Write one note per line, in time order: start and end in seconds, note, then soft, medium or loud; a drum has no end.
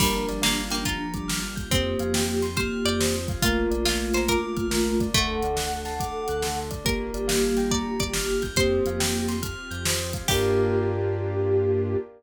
0.00 0.23 G1 loud
0.00 1.43 F3 medium
0.00 0.27 G3 medium
0.00 1.70 A#3 medium
0.00 0.26 A#3 loud
0.00 1.70 D4 medium
0.00 1.43 D4 medium
0.00 1.70 F4 medium
0.00 1.70 G4 medium
0.00 0.26 A#4 loud
0.00 kick loud
0.00 crash loud
0.29 0.98 G1 medium
0.29 0.97 G3 medium
0.29 0.42 D5 medium
0.29 snare soft
0.29 closed hi-hat medium
0.42 0.68 A#3 medium
0.42 0.67 F5 medium
0.42 snare loud
0.70 0.84 A#3 medium
0.70 0.84 G5 medium
0.70 snare medium
0.70 closed hi-hat medium
0.85 1.68 F4 medium
0.85 1.11 A#5 loud
0.85 kick medium
0.85 closed hi-hat loud
1.14 1.65 G1 medium
1.14 1.65 G3 medium
1.14 1.27 D6 medium
1.14 kick medium
1.14 closed hi-hat medium
1.28 1.54 F6 medium
1.28 snare loud
1.56 1.69 G6 medium
1.56 kick medium
1.56 closed hi-hat medium
1.71 1.95 F2 loud
1.71 2.47 A#3 medium
1.71 2.47 C4 medium
1.71 1.97 C4 loud
1.71 3.42 C4 medium
1.71 3.42 F4 medium
1.71 3.42 G4 medium
1.71 2.47 G4 medium
1.71 1.97 C5 loud
1.71 kick loud
1.71 closed hi-hat loud
1.99 2.69 F2 medium
1.99 2.68 F3 medium
1.99 2.13 F5 loud
1.99 closed hi-hat medium
2.14 2.41 G5 medium
2.14 snare loud
2.42 2.55 C6 medium
2.42 snare medium
2.42 closed hi-hat medium
2.57 3.16 A#3 medium
2.57 3.16 G4 medium
2.57 2.81 C5 medium
2.57 2.82 F6 loud
2.57 kick loud
2.57 closed hi-hat loud
2.85 3.36 F2 medium
2.85 3.36 F3 medium
2.85 3.40 D5 medium
2.85 2.98 G6 medium
2.85 closed hi-hat medium
3.00 3.26 C5 medium
3.00 snare loud
3.28 3.42 F5 medium
3.28 kick loud
3.28 closed hi-hat medium
3.42 3.67 A#1 loud
3.42 5.06 A3 medium
3.42 5.13 A#3 medium
3.42 3.69 A#3 loud
3.42 5.13 D4 medium
3.42 3.66 F4 medium
3.42 5.06 F4 medium
3.42 5.13 F4 medium
3.42 3.70 A#4 loud
3.42 kick loud
3.42 closed hi-hat loud
3.71 4.40 A#1 medium
3.71 4.40 A#3 medium
3.71 3.84 D5 medium
3.71 closed hi-hat medium
3.85 4.09 F4 medium
3.85 4.11 F5 medium
3.85 snare loud
4.14 4.26 C5 medium
4.14 4.28 A#5 medium
4.14 snare medium
4.14 closed hi-hat medium
4.28 5.09 A#4 medium
4.28 4.55 D6 loud
4.28 kick medium
4.28 closed hi-hat loud
4.57 5.08 A#1 medium
4.57 5.08 A#3 medium
4.57 4.70 F6 medium
4.57 kick medium
4.57 closed hi-hat medium
4.71 4.97 A#4 loud
4.71 snare loud
5.00 5.14 D5 medium
5.00 kick medium
5.00 closed hi-hat medium
5.13 5.38 D2 loud
5.13 5.40 A3 loud
5.13 6.26 A3 loud
5.13 6.86 A3 medium
5.13 6.85 D4 medium
5.13 6.86 F#4 medium
5.13 6.60 A4 medium
5.13 5.41 A4 loud
5.13 6.60 F#5 medium
5.13 kick loud
5.13 closed hi-hat loud
5.42 6.11 D2 medium
5.42 6.11 D3 medium
5.42 5.57 D5 medium
5.42 closed hi-hat medium
5.56 5.82 F#5 medium
5.56 snare loud
5.85 5.98 A5 medium
5.85 snare medium
5.85 closed hi-hat medium
6.00 6.26 D6 loud
6.00 kick medium
6.00 closed hi-hat loud
6.28 6.80 D2 medium
6.28 6.79 D3 medium
6.28 6.42 F#6 medium
6.28 closed hi-hat medium
6.42 6.69 A4 medium
6.42 snare loud
6.71 6.84 D5 medium
6.71 kick medium
6.71 closed hi-hat medium
6.84 7.10 G1 medium
6.84 8.42 A#3 medium
6.84 8.56 A#3 medium
6.84 7.12 A#3 loud
6.84 8.56 D4 medium
6.84 8.56 F4 medium
6.84 8.42 G4 medium
6.84 8.56 G4 medium
6.84 7.11 A#4 loud
6.84 7.60 A#4 medium
6.84 kick loud
6.84 closed hi-hat loud
7.14 7.83 G1 medium
7.14 7.83 G3 medium
7.14 7.27 D5 medium
7.14 closed hi-hat medium
7.28 7.53 F5 medium
7.28 snare loud
7.57 7.70 G5 medium
7.57 snare medium
7.57 closed hi-hat medium
7.71 7.97 D5 medium
7.71 7.97 A#5 loud
7.71 kick medium
8.00 8.51 G1 medium
8.00 8.51 G3 medium
8.00 8.50 D5 medium
8.00 8.13 D6 medium
8.00 kick medium
8.00 closed hi-hat medium
8.13 8.41 F6 loud
8.13 snare loud
8.42 8.56 G6 medium
8.42 kick medium
8.42 snare soft
8.42 closed hi-hat medium
8.56 8.80 F2 loud
8.56 9.35 A#3 medium
8.56 8.83 C4 loud
8.56 10.28 C4 medium
8.56 10.28 F4 medium
8.56 9.35 G4 medium
8.56 10.28 G4 medium
8.56 9.86 C5 loud
8.56 8.83 C5 loud
8.56 kick loud
8.56 closed hi-hat loud
8.86 9.55 F2 medium
8.86 9.54 F3 medium
8.86 9.00 F5 medium
8.86 closed hi-hat medium
9.00 9.26 G5 medium
9.00 snare loud
9.28 9.41 C6 medium
9.28 snare medium
9.28 closed hi-hat medium
9.42 9.68 F6 loud
9.42 kick medium
9.42 closed hi-hat loud
9.71 10.22 F2 medium
9.71 10.22 F3 medium
9.71 9.84 G6 medium
9.71 closed hi-hat medium
9.85 10.12 C5 medium
9.85 snare loud
10.13 10.27 F5 medium
10.13 kick medium
10.13 closed hi-hat medium
10.28 11.97 G2 loud
10.28 11.97 A#3 medium
10.28 11.96 A#3 loud
10.28 11.97 D4 loud
10.28 11.96 D4 medium
10.28 11.97 F4 loud
10.28 11.96 F4 medium
10.28 11.96 G4 loud
10.28 11.97 G4 loud
10.28 11.98 G4 loud
10.28 11.97 A#4 loud
10.28 11.97 D5 loud
10.28 11.97 F5 medium
10.28 11.97 G5 loud
10.28 kick loud
10.28 crash loud